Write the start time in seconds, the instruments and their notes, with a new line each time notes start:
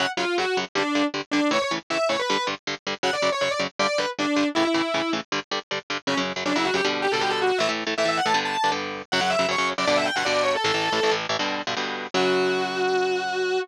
0.00 overdriven guitar F#2 C#3 F#3, distortion guitar F#5
0.17 overdriven guitar F#2 C#3 F#3, distortion guitar F4
0.38 overdriven guitar F#2 C#3 F#3, distortion guitar F#4
0.57 overdriven guitar F#2 C#3 F#3
0.75 overdriven guitar G2 D3 G3, distortion guitar D4
0.95 overdriven guitar G2 D3 G3
1.14 overdriven guitar G2 D3 G3
1.31 overdriven guitar G2 D3 G3, distortion guitar D4
1.51 overdriven guitar A2 C#3 E3, distortion guitar C#5
1.62 distortion guitar C#5
1.71 overdriven guitar A2 C#3 E3
1.90 overdriven guitar A2 C#3 E3, distortion guitar E5
2.09 overdriven guitar A2 C#3 E3, distortion guitar C#5
2.19 distortion guitar B4
2.30 overdriven guitar G2 D3 G3
2.47 overdriven guitar G2 D3 G3
2.67 overdriven guitar G2 D3 G3
2.87 overdriven guitar G2 D3 G3
3.03 overdriven guitar F#2 C#3 F#3, distortion guitar F#5
3.13 distortion guitar D5
3.22 overdriven guitar F#2 C#3 F#3
3.32 distortion guitar C#5
3.41 overdriven guitar F#2 C#3 F#3, distortion guitar C#5
3.51 distortion guitar D5
3.59 overdriven guitar F#2 C#3 F#3
3.79 overdriven guitar G2 D3 G3, distortion guitar D5
3.98 overdriven guitar G2 D3 G3, distortion guitar B4
4.19 overdriven guitar G2 D3 G3, distortion guitar D4
4.36 overdriven guitar G2 D3 G3
4.55 overdriven guitar A2 C#3 E3, distortion guitar E4
4.65 distortion guitar E4
4.74 overdriven guitar A2 C#3 E3
4.94 overdriven guitar A2 C#3 E3
5.13 overdriven guitar A2 C#3 E3
5.32 overdriven guitar G2 D3 G3
5.51 overdriven guitar G2 D3 G3
5.71 overdriven guitar G2 D3 G3
5.90 overdriven guitar G2 D3 G3
6.07 overdriven guitar F#2 C#3 F#3, distortion guitar C#4
6.17 overdriven guitar F#2 C#3 F#3
6.36 overdriven guitar F#2 C#3 F#3
6.45 overdriven guitar F#2 C#3 F#3, distortion guitar D4
6.56 overdriven guitar F#2 C#3 F#3, distortion guitar E4
6.65 distortion guitar F#4
6.74 overdriven guitar F#2 C#3 F#3, distortion guitar G4
6.85 overdriven guitar B2 D3 G3
7.02 distortion guitar G4
7.12 overdriven guitar B2 D3 G3, distortion guitar A4
7.21 overdriven guitar B2 D3 G3, distortion guitar G4
7.30 distortion guitar A4
7.42 distortion guitar F#4
7.58 overdriven guitar A2 E3 A3, distortion guitar E5
7.69 overdriven guitar A2 E3 A3
7.87 overdriven guitar A2 E3 A3
7.98 overdriven guitar A2 E3 A3, distortion guitar E5
8.05 overdriven guitar A2 E3 A3, distortion guitar E5
8.17 distortion guitar F#5
8.26 overdriven guitar A2 E3 A3, distortion guitar A5
8.34 overdriven guitar G2 D3 B3
8.45 distortion guitar A5
8.64 overdriven guitar G2 D3 B3
8.72 overdriven guitar G2 D3 B3
9.12 overdriven guitar F#2 C#3 F#3, distortion guitar F#5
9.21 overdriven guitar F#2 C#3 F#3, distortion guitar F#5
9.30 distortion guitar E5
9.39 overdriven guitar F#2 C#3 F#3
9.48 overdriven guitar F#2 C#3 F#3, distortion guitar C#5
9.58 overdriven guitar F#2 C#3 F#3
9.78 overdriven guitar F#2 C#3 F#3, distortion guitar D5
9.87 overdriven guitar G2 B2 D3, distortion guitar D5
9.96 distortion guitar E5
10.05 distortion guitar G5
10.16 overdriven guitar G2 B2 D3, distortion guitar F#5
10.25 overdriven guitar G2 B2 D3, distortion guitar D5
10.43 distortion guitar C#5
10.55 distortion guitar A4
10.64 overdriven guitar A1 A2 E3, distortion guitar A4
10.74 overdriven guitar A1 A2 E3
10.92 overdriven guitar A1 A2 E3
11.03 overdriven guitar A1 A2 E3
11.11 overdriven guitar A1 A2 E3
11.29 overdriven guitar A1 A2 E3
11.39 overdriven guitar G2 B2 D3
11.67 overdriven guitar G2 B2 D3
11.77 overdriven guitar G2 B2 D3
12.14 overdriven guitar F#2 C#3 F#3, distortion guitar F#4